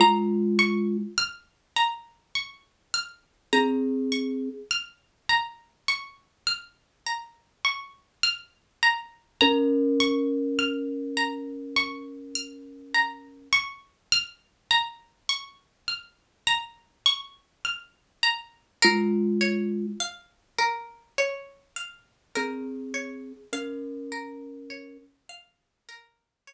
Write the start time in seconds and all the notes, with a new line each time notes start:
0.00 G#3 F4 A#5
0.59 C#6
1.18 F6
1.76 A#5
2.35 C#6
2.94 F6
3.53 C4 G#4 A#5
4.12 C#6
4.71 F6
5.29 A#5
5.88 C#6
6.47 F6
7.06 A#5
7.65 C#6
8.23 F6
8.83 A#5
9.41 C#4 A#4 A#5
10.00 C#6
10.59 F6
11.17 A#5
11.76 C#6
12.35 F6
12.94 A#5
13.53 C#6
14.12 F6
14.71 A#5
15.29 C#6
15.88 F6
16.47 A#5
17.06 C#6
17.65 F6
18.23 A#5
18.82 G#3 F4 A#4
19.41 C#5
20.00 F5
20.59 A#4
21.18 C#5
21.76 F5
22.36 C4 G#4 A#4
22.94 C#5
23.53 C#4 A#4 F5
24.12 A#4
24.70 C#5
25.29 F5
25.89 A#4
26.47 C#5